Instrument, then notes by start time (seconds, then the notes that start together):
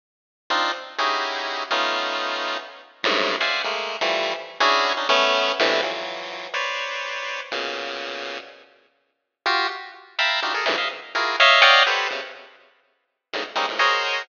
lead 1 (square)
0.50 C4 D4 D#4 F4
0.98 C#4 D#4 E4 F#4 G4 G#4
1.70 A3 B3 C#4 D#4 F4
3.03 F#2 G2 G#2 A2
3.40 C5 D5 E5 F5 F#5 G#5
3.64 G#3 A3 A#3
4.01 E3 F3 G3 A3
4.60 C#4 D4 E4 F#4 G#4
4.97 C#4 D4 D#4
5.09 A3 B3 C#4
5.59 A2 B2 C3 D3 E3
5.82 E3 F3 F#3
6.54 B4 C5 C#5 D5
7.51 A#2 B2 C#3
9.46 F4 F#4 G4
10.18 E5 F5 G5 A5 A#5 B5
10.42 D4 D#4 F4 F#4 G4
10.54 G#4 A4 A#4
10.65 F#2 G#2 A#2 C3 D3 E3
10.77 D#5 E5 F5
11.15 E4 F4 F#4 G#4 A#4
11.40 C#5 D#5 E5 F5
11.61 C#5 D5 D#5 F5 F#5 G5
11.86 G4 A4 B4 C5
12.10 B2 C3 C#3
13.33 G#2 A2 B2 C#3 D3 D#3
13.55 G3 G#3 A#3 C4 C#4 D#4
13.68 G#2 A2 A#2
13.79 F#4 G#4 A#4 C5 C#5 D#5